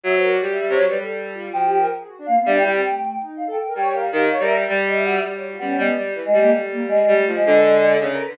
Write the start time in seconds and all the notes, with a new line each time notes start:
0.04 F#3 E5
0.14 C5
0.23 A#4
0.33 D5
0.41 G3
0.51 E5
0.60 G3
0.69 C3 C#5
0.78 F#3
0.89 G3 B4
0.98 G3 A4
1.34 F4
1.53 F3 F#4 G5
1.66 G4
1.77 A#4
1.99 G#4
2.08 F#4
2.18 D4
2.26 A#3 F5
2.36 B3
2.46 G3 D4 E5
2.57 E4 G5
2.64 G3
2.70 C4 G5
2.82 A3 G5
3.02 G5
3.19 D#4
3.37 F5
3.47 A4 G5
3.62 G5
3.66 A#4
3.75 G3 C#5 G5
3.93 A#4 F5
4.12 D#3 G4
4.30 C#5
4.39 G3 A#4 E5
4.56 E5
4.67 G3 D5
4.86 D#5
4.95 E5
5.04 F#4 E5
5.23 G3 D5
5.33 C#5
5.42 F#4
5.51 F4
5.59 G3 B3 C#4
5.77 G3 G#3 B3
5.97 G3
6.15 E3 A3
6.25 G#3 A3
6.33 G3
6.40 A#3
6.52 G3 A3
6.72 A#3
6.81 A3
6.88 G#3
7.08 G3 A3
7.21 A3
7.27 F3
7.34 G#3 F4
7.45 D3 G#3 B4
8.00 C#3 D4 E5
8.12 A4 A#4
8.26 D3 B4